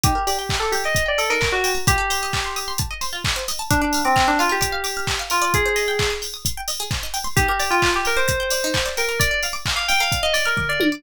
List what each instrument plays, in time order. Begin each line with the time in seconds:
0.04 pizzicato strings D#4, electric piano 2 G4, kick, closed hi-hat
0.15 pizzicato strings A#4
0.27 electric piano 2 G4, pizzicato strings D5, open hi-hat
0.39 pizzicato strings G5
0.49 pizzicato strings A#5, kick, clap
0.60 electric piano 2 A4, pizzicato strings D6
0.72 electric piano 2 G4, pizzicato strings G6, open hi-hat
0.84 electric piano 2 D#5, pizzicato strings D6
0.95 pizzicato strings A#5, kick, closed hi-hat
1.06 electric piano 2 D5, pizzicato strings G5
1.18 electric piano 2 A4, pizzicato strings D5, open hi-hat
1.30 pizzicato strings D#4, electric piano 2 A#4
1.41 pizzicato strings A#4, kick, clap
1.52 electric piano 2 F#4, pizzicato strings D5
1.64 pizzicato strings G5, open hi-hat
1.75 pizzicato strings A#5
1.87 pizzicato strings F4, electric piano 2 G4, kick, closed hi-hat
1.98 pizzicato strings A4
2.10 pizzicato strings C5, open hi-hat
2.23 pizzicato strings D#5
2.33 pizzicato strings A5, kick, clap
2.44 pizzicato strings C6
2.56 pizzicato strings D#6, open hi-hat
2.68 pizzicato strings C6
2.78 pizzicato strings A5, kick, closed hi-hat
2.91 pizzicato strings D#5
3.01 pizzicato strings C5, open hi-hat
3.13 pizzicato strings F4
3.24 pizzicato strings A4, kick, clap
3.36 pizzicato strings C5
3.48 pizzicato strings D#5, open hi-hat
3.59 pizzicato strings A5
3.71 electric piano 2 D4, pizzicato strings A#4, kick, closed hi-hat
3.81 electric piano 2 D4, pizzicato strings D5
3.93 pizzicato strings F5, open hi-hat
4.05 electric piano 2 C4, pizzicato strings D6
4.16 pizzicato strings F6, kick, clap
4.28 electric piano 2 D4, pizzicato strings D6
4.39 electric piano 2 F4, pizzicato strings F5, open hi-hat
4.49 electric piano 2 G4, pizzicato strings A#4
4.61 pizzicato strings D5, kick, closed hi-hat
4.72 pizzicato strings F5
4.84 pizzicato strings D6, open hi-hat
4.97 pizzicato strings F6
5.07 pizzicato strings D6, kick, clap
5.19 pizzicato strings F5
5.30 electric piano 2 F4, pizzicato strings A#4, open hi-hat
5.42 pizzicato strings D5
5.54 pizzicato strings G#4, electric piano 2 G#4, kick, closed hi-hat
5.66 pizzicato strings C5
5.76 pizzicato strings D#5, open hi-hat
5.88 pizzicato strings G5
5.99 pizzicato strings C6, kick, clap
6.10 pizzicato strings D#6
6.22 pizzicato strings G6, open hi-hat
6.34 pizzicato strings D#6
6.45 pizzicato strings C6, kick, closed hi-hat
6.57 pizzicato strings G5
6.68 pizzicato strings D#5, open hi-hat
6.80 pizzicato strings G#4
6.91 pizzicato strings C5, kick, clap
7.03 pizzicato strings D#5
7.14 pizzicato strings G5, open hi-hat
7.24 pizzicato strings C6
7.36 pizzicato strings D#4, electric piano 2 G4, kick, closed hi-hat
7.48 electric piano 2 G4, pizzicato strings A#4
7.60 pizzicato strings D5, open hi-hat
7.71 electric piano 2 F4, pizzicato strings G5
7.82 pizzicato strings A#5, kick, clap
7.94 electric piano 2 G4, pizzicato strings D6
8.05 electric piano 2 A#4, pizzicato strings G6, open hi-hat
8.17 electric piano 2 C5, pizzicato strings D6
8.28 pizzicato strings A#5, kick, closed hi-hat
8.40 pizzicato strings G5
8.50 pizzicato strings D5, open hi-hat
8.64 pizzicato strings D#4
8.74 pizzicato strings A#4, kick, clap
8.86 pizzicato strings D5
8.97 electric piano 2 A#4, pizzicato strings G5, open hi-hat
9.09 pizzicato strings A#5
9.19 pizzicato strings A#4, electric piano 2 D5, kick, closed hi-hat
9.31 pizzicato strings D5
9.43 pizzicato strings F5, open hi-hat
9.53 pizzicato strings D6
9.66 pizzicato strings F6, kick, clap
9.76 electric piano 2 F5, pizzicato strings D6
9.88 pizzicato strings F5, electric piano 2 G5, open hi-hat
10.00 pizzicato strings A#4, electric piano 2 F5
10.12 pizzicato strings D5, kick, closed hi-hat
10.23 electric piano 2 D#5, pizzicato strings F5
10.33 electric piano 2 D5, pizzicato strings D6, open hi-hat
10.46 electric piano 2 A#4, pizzicato strings F6
10.57 pizzicato strings D6, kick, floor tom
10.69 electric piano 2 D5, pizzicato strings F5
10.80 pizzicato strings A#4, high tom
10.92 pizzicato strings D5